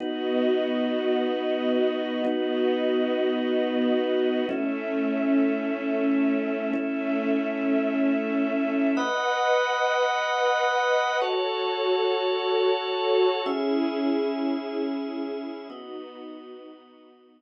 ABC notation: X:1
M:4/4
L:1/8
Q:1/4=107
K:Bmix
V:1 name="Drawbar Organ"
[B,DF]8 | [B,DF]8 | [A,CE]8 | [A,CE]8 |
[Bdf]8 | [FAc]8 | [CGe]8 | [B,Fd]8 |]
V:2 name="String Ensemble 1"
[B,Fd]8 | [B,Fd]8 | [A,Ce]8 | [A,Ce]8 |
[Bdf]8 | [FAc]8 | [CEG]8 | [B,DF]8 |]